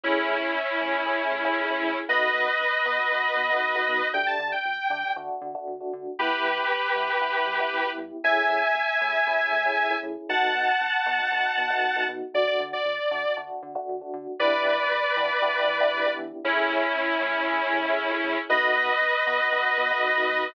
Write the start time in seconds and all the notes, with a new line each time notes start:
0.04 A1 A3 C#4 E4 G#4
0.29 A2
0.55 A1
0.80 A2 A3 C#4 E4 G#4
1.06 A1 A3 C#4 E4 G#4
1.32 A2
1.45 A3 C#4 E4 G#4
1.57 A1
1.70 A3 C#4 E4 G#4
1.83 A2
2.08 B1 A3 B3 D#4 F#4 B4 D#5
2.34 B2
2.60 B1
2.86 B2 A3 B3 D#4 F#4
3.11 B1 A3 B3 D#4 F#4
3.37 B2
3.50 A3 B3 D#4 F#4
3.63 B1
3.75 A3 B3 D#4 F#4
3.88 B2
4.14 D2 A3 D4 G4 G5
4.27 A5
4.39 D3
4.52 G5
4.65 D2
4.90 D3 A3 D4 G4
5.16 D2 A3 D4 F#4
5.42 D3
5.55 A3 D4 F#4
5.67 D2
5.80 A3 D4 F#4
5.93 D3
6.19 G1 B3 E4 G4 B4
6.45 G2
6.71 G1
6.96 G2 B3 E4 G4
7.21 G1 B3 E4 G4
7.47 G2
7.60 B3 E4 G4
7.73 G1
7.86 B3 E4 G4
7.98 G2
8.24 A1 A3 C#4 E4 G#4 E5 G#5
8.50 A2
8.75 A1
9.01 A2 A3 C#4 E4 G#4
9.27 A1 A3 C#4 E4 G#4
9.52 A2
9.65 A3 C#4 E4 G#4
9.78 A1
9.91 A3 C#4 E4 G#4
10.03 A2
10.29 B1 A3 B3 D#4 F#4 F#5 A5
10.55 B2
10.81 B1
11.06 B2 A3 B3 D#4 F#4
11.32 B1 A3 B3 D#4 F#4
11.58 B2
11.70 A3 B3 D#4 F#4
11.83 B1
11.96 A3 B3 D#4 F#4
12.08 B2
12.34 D2 A3 D4 F#4 D5
12.47 D5
12.60 D3
12.73 D5
12.86 D2
13.11 D3 A3 D4 F#4
13.37 D2 A3 D4 F#4
13.63 D3
13.75 A3 D4 F#4
13.89 D2
14.01 A3 D4 F#4
14.14 D3
14.39 E2 B3 D4 E4 G4 B4 D5
14.65 E3
14.91 E2
15.17 E3 B3 D4 E4 G4
15.41 E2 B3 D4 E4 G4
15.68 E3
15.80 B3 D4 E4 G4
15.93 E2
16.06 B3 D4 E4 G4
16.19 E3
16.44 A1 A3 C#4 E4 G#4
16.70 A2
16.96 A1
17.21 A2 A3 C#4 E4 G#4
17.47 A1 A3 C#4 E4 G#4
17.73 A2
17.86 A3 C#4 E4 G#4
17.98 A1
18.11 A3 C#4 E4 G#4
18.24 A2
18.49 B1 A3 B3 D#4 F#4 B4 D#5
18.76 B2
19.01 B1
19.26 B2 A3 B3 D#4 F#4
19.52 B1 A3 B3 D#4 F#4
19.78 B2
19.91 A3 B3 D#4 F#4
20.04 B1
20.16 A3 B3 D#4 F#4
20.29 B2